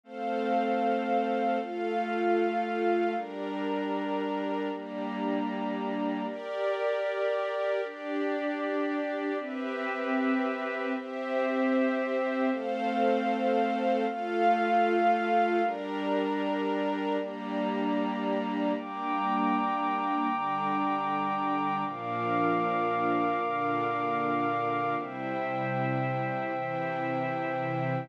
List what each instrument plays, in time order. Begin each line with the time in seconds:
0.04 pad 5 (bowed) A3 C4 F5, string ensemble 1 A4 C5 F5
1.60 pad 5 (bowed) A3 F4 F5, string ensemble 1 F4 A4 F5
3.15 pad 5 (bowed) G3 D4 A#5, string ensemble 1 G4 A#4 D5
4.71 pad 5 (bowed) G3 A#3 A#5, string ensemble 1 D4 G4 D5
6.27 string ensemble 1 G4 A#4 D5, pad 5 (bowed) G4 A#4 D5
7.83 pad 5 (bowed) D4 G4 D5, string ensemble 1 D4 G4 D5
9.38 pad 5 (bowed) C4 G4 B4 E5, string ensemble 1 C4 G4 B4 E5
10.96 string ensemble 1 C4 G4 C5 E5, pad 5 (bowed) C4 G4 C5 E5
12.51 pad 5 (bowed) A3 C4 F5, string ensemble 1 A4 C5 F5
14.07 pad 5 (bowed) A3 F4 F5, string ensemble 1 F4 A4 F5
15.62 pad 5 (bowed) G3 D4 A#5, string ensemble 1 G4 A#4 D5
17.19 pad 5 (bowed) G3 A#3 A#5, string ensemble 1 D4 G4 D5
18.74 string ensemble 1 G3 A#3 D4, pad 5 (bowed) G5 A#5 D6
20.30 string ensemble 1 D3 G3 D4
21.85 string ensemble 1 A#2 F3 D4, pad 5 (bowed) A#4 F5 D6
23.41 string ensemble 1 A#2 D3 D4
24.96 string ensemble 1 C3 G3 E4, pad 5 (bowed) C5 E5 G5
26.53 string ensemble 1 C3 E3 E4